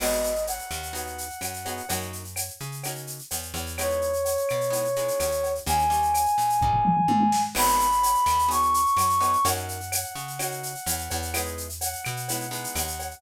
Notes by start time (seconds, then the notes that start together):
0.00 G#1 B3 D#4 F#4 G#4 D#5, crash, cowbell, claves
0.12 shaker
0.24 shaker
0.35 shaker
0.47 F#5, cowbell, shaker
0.59 shaker
0.71 D#2, claves, shaker
0.83 shaker
0.93 B3 D#4 F#4 G#4, cowbell, shaker
1.06 shaker
1.18 shaker
1.30 shaker
1.41 F#2, cowbell, claves, shaker
1.54 shaker
1.65 B3 D#4 F#4 G#4, cowbell, shaker
1.77 shaker
1.89 F#2 A#3 C#4 D#4 F#4, cowbell, shaker
2.01 shaker
2.13 shaker
2.25 shaker
2.36 cowbell, claves, shaker
2.48 shaker
2.60 C#3, shaker
2.72 shaker
2.83 A#3 C#4 D#4 F#4, cowbell, claves, shaker
2.95 shaker
3.07 shaker
3.19 shaker
3.31 E2, cowbell, shaker
3.42 shaker
3.54 E2, cowbell, shaker
3.66 shaker
3.78 G#3 B3 D#4 E4 C#5, cowbell, claves, shaker
3.90 shaker
4.01 shaker
4.13 shaker
4.25 cowbell, shaker
4.37 shaker
4.49 B2, claves, shaker
4.61 shaker
4.70 G#3 B3 D#4 E4, cowbell, shaker
4.84 shaker
4.96 G#3 B3 D#4 E4, shaker
5.08 shaker
5.20 D#2, cowbell, claves, shaker
5.31 shaker
5.43 cowbell, shaker
5.55 shaker
5.66 D#2 G3 A#3 C#4 D#4 G#5, cowbell, shaker
5.79 shaker
5.90 G3 A#3 C#4 D#4, shaker
6.02 shaker
6.14 cowbell, claves, shaker
6.26 shaker
6.38 A#2, shaker
6.50 shaker
6.61 G3 A#3 C#4 D#4, kick, floor tom
6.73 floor tom
6.85 mid tom
6.97 mid tom
7.08 G#2, high tom
7.20 high tom
7.32 snare
7.55 G#1 B3 D#4 F#4 G#4 B5, crash, cowbell, claves
7.68 shaker
7.79 shaker
7.92 shaker
8.03 cowbell, shaker
8.15 shaker
8.26 D#2, claves, shaker
8.39 shaker
8.49 B3 D#4 F#4 G#4 C#6, cowbell, shaker
8.62 shaker
8.74 shaker
8.86 shaker
8.96 F#2, cowbell, claves, shaker
9.09 shaker
9.20 B3 D#4 F#4 G#4, cowbell, shaker
9.33 shaker
9.45 F#2 A#3 C#4 D#4 F#4 F#5, cowbell, shaker
9.57 shaker
9.68 shaker
9.80 shaker
9.92 cowbell, claves, shaker
10.04 shaker
10.15 C#3, shaker
10.28 shaker
10.39 A#3 C#4 D#4 F#4, cowbell, claves, shaker
10.51 shaker
10.63 shaker
10.75 shaker
10.86 E2, cowbell, shaker
10.98 shaker
11.10 E2, cowbell, shaker
11.22 shaker
11.34 G#3 B3 D#4 E4, cowbell, claves, shaker
11.45 shaker
11.57 shaker
11.69 shaker
11.81 F#5, cowbell, shaker
11.93 shaker
12.05 B2, claves, shaker
12.17 shaker
12.28 G#3 B3 D#4 E4, cowbell, shaker
12.40 shaker
12.51 G#3 B3 D#4 E4, shaker
12.64 shaker
12.75 D#2, cowbell, claves, shaker
12.87 shaker
12.99 cowbell, shaker
13.11 shaker